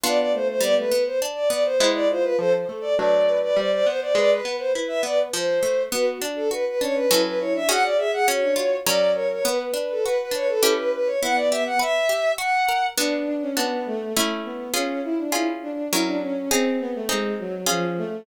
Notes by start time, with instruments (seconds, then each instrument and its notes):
0.04 harpsichord B3 D4 F4, violin B3 D5
0.18 violin D5
0.33 violin A3 C5
0.48 violin C5
0.60 harpsichord G3, violin B3 D5
0.77 violin A3 B4
0.92 harpsichord B3
1.06 violin C5
1.22 harpsichord D4
1.35 violin D5
1.50 harpsichord B3, violin D5
1.64 violin C5
1.80 harpsichord G#3 B3 E4, violin E4
1.94 violin D5
2.10 violin F4 C5
2.23 violin B4
2.39 harpsichord F3, violin A4 C5
2.54 violin C5
2.69 harpsichord A3, violin A4
2.81 violin D5
2.97 harpsichord F#3 A3 D4, violin B4 D5
3.27 violin B4
3.43 violin D5
3.56 harpsichord G3, violin C5 D5
3.71 violin C5 D5
3.86 harpsichord B3, violin C5
4.01 violin D5
4.15 harpsichord G#3, violin B4 D5
4.30 violin B4
4.45 harpsichord B3
4.58 violin C5
4.74 harpsichord E4, violin B4
4.88 violin E5
5.03 harpsichord B3, violin D5
5.33 harpsichord F3, violin C5
5.63 harpsichord A3
5.92 harpsichord B3, violin F#4 B4
6.21 violin D4, harpsichord D4
6.36 violin A4
6.51 harpsichord F#4, violin B4
6.67 violin B4
6.80 violin C#4 C#5, harpsichord D4
6.94 violin B4
7.10 harpsichord F#3 C#4 A4, violin E4
7.25 violin B4
7.39 violin E4 C#5
7.54 violin D4 E5
7.68 harpsichord C#4 F#4 G#4, violin F#4 F#5
7.83 violin D5
7.98 violin G#4 E5
8.12 violin G#4 F#5
8.27 harpsichord C#4, violin F#4 C#5
8.42 violin D4
8.56 harpsichord F4, violin F#4
8.85 harpsichord F#3 C#4 A#4, violin D5
9.14 violin A#4 C#5
9.32 violin C#5
9.45 harpsichord B3, violin B4
9.74 harpsichord D4
9.91 violin A4
10.04 harpsichord F#4, violin B4
10.19 violin B4
10.31 harpsichord D4, violin C#5
10.48 violin A4
10.63 harpsichord C#4 E4 G4
10.77 violin B4
10.94 violin B4
11.06 violin C#5
11.21 violin B3 F#5, harpsichord E4
11.35 violin D5
11.50 harpsichord G4, violin E5
11.66 violin F#5
11.79 harpsichord B4, violin E5
12.09 harpsichord G4
12.38 harpsichord F#4, violin F#5
12.69 harpsichord A#4
12.98 harpsichord B3 D4 F#4, violin D4
13.27 violin D4
13.42 violin C#4
13.57 violin B3, harpsichord B3 D4 F#4
13.86 violin A3
14.15 violin A3, harpsichord A3 C#4 E4
14.45 violin B3
14.74 harpsichord C#4 F4 G#4, violin C#4
15.04 violin E4
15.18 violin D4
15.32 harpsichord C#4 F4 G#4, violin E4
15.62 violin D4
15.92 harpsichord F#3 C#4 A#4, violin E4
16.07 violin D4
16.21 violin C#4
16.51 violin C4, harpsichord C4 D#4 G#4
16.80 violin B3
16.95 violin A3
17.09 violin G#3, harpsichord C4 D#4 G#4
17.39 violin F#3
17.66 violin F3, harpsichord C#4 F4 G#4
17.98 violin A3